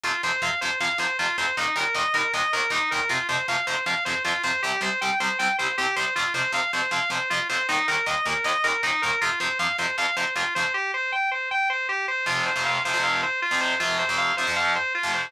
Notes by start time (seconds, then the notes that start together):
0.04 F2 C3 F3 F4
0.23 F2 C3 F3 C5
0.42 F2 C3 F3 F5
0.61 F2 C3 F3 C5
0.80 F2 C3 F3 F5
0.98 F2 C3 F3 C5
1.19 F2 C3 F3 F4
1.38 F2 C3 F3 C5
1.57 D#2 A#2 D#3 D#4
1.76 D#2 A#2 D#3 A#4
1.95 D#2 A#2 D#3 D#5
2.14 D#2 A#2 D#3 A#4
2.34 D#2 A#2 D#3 D#5
2.53 D#2 A#2 D#3 A#4
2.70 D#2 A#2 D#3 D#4
2.91 D#2 A#2 D#3 A#4
3.09 F2 C3 F3 F4
3.29 F2 C3 F3 C5
3.48 F2 C3 F3 F5
3.67 F2 C3 F3 C5
3.86 F2 C3 F3 F5
4.05 F2 C3 F3 C5
4.25 F2 C3 F3 F4
4.43 F2 C3 F3 C5
4.63 C2 C3 G3 G4
4.81 C2 C3 G3 C5
5.01 C2 C3 G3 G5
5.20 C2 C3 G3 C5
5.39 C2 C3 G3 G5
5.58 C2 C3 G3 C5
5.78 C2 C3 G3 G4
5.96 C2 C3 G3 C5
6.16 F2 C3 F3 F4
6.34 F2 C3 F3 C5
6.52 F2 C3 F3 F5
6.73 F2 C3 F3 C5
6.91 F2 C3 F3 F5
7.10 F2 C3 F3 C5
7.30 F2 C3 F3 F4
7.49 F2 C3 F3 C5
7.69 D#2 A#2 D#3 D#4
7.88 D#2 A#2 D#3 A#4
8.06 D#2 A#2 D#3 D#5
8.25 D#2 A#2 D#3 A#4
8.44 D#2 A#2 D#3 D#5
8.64 D#2 A#2 D#3 A#4
8.83 D#2 A#2 D#3 D#4
9.02 D#2 A#2 D#3 A#4
9.21 F2 C3 F3 F4
9.40 F2 C3 F3 C5
9.59 F2 C3 F3 F5
9.78 F2 C3 F3 C5
9.98 F2 C3 F3 F5
10.17 F2 C3 F3 C5
10.36 F2 C3 F3 F4
10.55 F2 C3 F3 C5
10.74 G4
10.94 C5
11.12 G5
11.31 C5
11.51 G5
11.70 C5
11.89 G4
12.08 C5
12.26 F2 C3 F3 F4
12.46 C5
12.56 F2 C3 F3
12.65 F5
12.85 F2 C3 F3 C5
12.94 F2 C3 F3
13.03 F5
13.23 C5
13.42 F4
13.51 F2 C3 F3
13.61 C5
13.80 F2 C3 F3 F4
13.99 C5
14.09 F2 C3 F3
14.18 F5
14.37 F2 C3 F3 C5
14.47 F2 C3 F3
14.56 F5
14.76 C5
14.95 F4
15.03 F2 C3 F3
15.14 C5